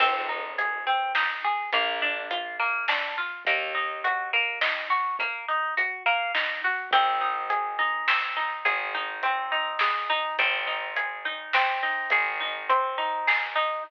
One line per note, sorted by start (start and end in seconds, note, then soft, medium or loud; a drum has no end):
0.00 1.59 G#1 medium
0.00 0.26 C4 medium
0.00 kick loud
0.00 crash loud
0.29 0.55 D#4 medium
0.58 0.84 G#4 medium
0.58 closed hi-hat loud
0.87 1.12 C4 medium
1.15 1.41 D#4 medium
1.15 snare loud
1.44 1.70 G#4 medium
1.72 3.32 A#1 medium
1.72 2.00 A#3 medium
1.72 kick loud
1.72 closed hi-hat loud
2.02 2.28 D4 medium
2.31 2.56 F4 medium
2.31 closed hi-hat loud
2.59 2.85 A#3 medium
2.88 3.14 D4 medium
2.88 snare loud
3.17 3.43 F4 medium
3.45 6.65 D#2 medium
3.45 3.72 A#3 medium
3.45 kick loud
3.45 closed hi-hat loud
3.75 4.00 D#4 medium
4.04 4.30 F#4 medium
4.04 closed hi-hat loud
4.33 4.59 A#3 medium
4.61 4.87 D#4 medium
4.61 snare loud
4.90 5.16 F#4 medium
5.19 5.45 A#3 medium
5.19 kick loud
5.19 closed hi-hat loud
5.48 5.74 D#4 medium
5.77 6.03 F#4 medium
5.77 closed hi-hat loud
6.06 6.32 A#3 medium
6.34 6.60 D#4 medium
6.34 snare loud
6.64 6.90 F#4 medium
6.91 8.52 G#1 medium
6.91 8.07 C4 loud
6.91 kick loud
6.91 closed hi-hat loud
7.21 7.78 D#4 medium
7.50 8.65 G#4 medium
7.50 closed hi-hat loud
7.78 8.36 D#4 medium
8.08 9.22 C4 medium
8.08 snare loud
8.36 8.94 D#4 medium
8.65 10.24 G#1 medium
8.65 9.80 G#4 medium
8.65 kick loud
8.65 closed hi-hat loud
8.94 9.51 D#4 medium
9.23 10.33 C4 medium
9.23 closed hi-hat loud
9.52 10.09 D#4 medium
9.79 10.35 G#4 medium
9.79 snare loud
10.09 10.37 D#4 medium
10.38 11.98 G#1 medium
10.38 11.53 C4 medium
10.38 kick loud
10.38 closed hi-hat loud
10.67 11.25 D#4 medium
10.96 12.11 G#4 medium
10.96 closed hi-hat loud
11.25 11.82 D#4 medium
11.53 12.69 C4 medium
11.53 snare loud
11.83 12.40 D#4 medium
12.10 13.71 G#1 medium
12.10 13.27 G#4 medium
12.10 kick loud
12.10 closed hi-hat loud
12.40 12.97 D#4 medium
12.69 13.79 C4 medium
12.69 closed hi-hat loud
12.98 13.55 D#4 medium
13.27 13.82 G#4 medium
13.27 snare loud
13.55 13.83 D#4 medium